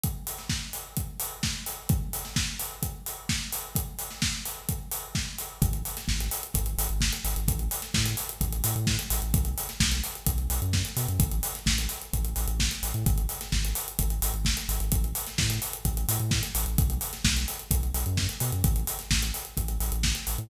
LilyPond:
<<
  \new Staff \with { instrumentName = "Synth Bass 2" } { \clef bass \time 4/4 \key gis \phrygian \tempo 4 = 129 r1 | r1 | r1 | gis,,4 gis,,4 gis,,8 gis,,16 gis,,8. gis,,16 gis,,16 |
a,,4 a,4 a,,8 a,16 a,8. a,,16 a,,16 | b,,4 b,,4 b,,8 b,,16 fis,8. b,16 fis,16 | a,,4 a,,4 a,,8 a,,16 a,,8. a,,16 a,16 | gis,,4 gis,,4 gis,,8 gis,,16 gis,,8. gis,,16 gis,,16 |
a,,4 a,4 a,,8 a,16 a,8. a,,16 a,,16 | b,,4 b,,4 b,,8 b,,16 fis,8. b,16 fis,16 | a,,4 a,,4 a,,8 a,,16 a,,8. a,,16 a,16 | }
  \new DrumStaff \with { instrumentName = "Drums" } \drummode { \time 4/4 <hh bd>8 hho16 sn16 <bd sn>8 hho8 <hh bd>8 hho8 <bd sn>8 hho8 | <hh bd>8 hho16 sn16 <bd sn>8 hho8 <hh bd>8 hho8 <bd sn>8 hho8 | <hh bd>8 hho16 sn16 <bd sn>8 hho8 <hh bd>8 hho8 <bd sn>8 hho8 | <hh bd>16 hh16 hho16 <hh sn>16 <bd sn>16 hh16 hho16 hh16 <hh bd>16 hh16 hho16 hh16 <bd sn>16 hh16 hho16 hh16 |
<hh bd>16 hh16 hho16 <hh sn>16 <bd sn>16 hh16 hho16 hh16 <hh bd>16 hh16 hho16 hh16 <bd sn>16 hh16 hho16 hh16 | <hh bd>16 hh16 hho16 <hh sn>16 <bd sn>16 hh16 hho16 hh16 <hh bd>16 hh16 hho16 hh16 <bd sn>16 hh16 hho16 hh16 | <hh bd>16 hh16 hho16 <hh sn>16 <bd sn>16 hh16 hho16 hh16 <hh bd>16 hh16 hho16 hh16 <bd sn>16 hh16 hho16 hh16 | <hh bd>16 hh16 hho16 <hh sn>16 <bd sn>16 hh16 hho16 hh16 <hh bd>16 hh16 hho16 hh16 <bd sn>16 hh16 hho16 hh16 |
<hh bd>16 hh16 hho16 <hh sn>16 <bd sn>16 hh16 hho16 hh16 <hh bd>16 hh16 hho16 hh16 <bd sn>16 hh16 hho16 hh16 | <hh bd>16 hh16 hho16 <hh sn>16 <bd sn>16 hh16 hho16 hh16 <hh bd>16 hh16 hho16 hh16 <bd sn>16 hh16 hho16 hh16 | <hh bd>16 hh16 hho16 <hh sn>16 <bd sn>16 hh16 hho16 hh16 <hh bd>16 hh16 hho16 hh16 <bd sn>16 hh16 hho16 hh16 | }
>>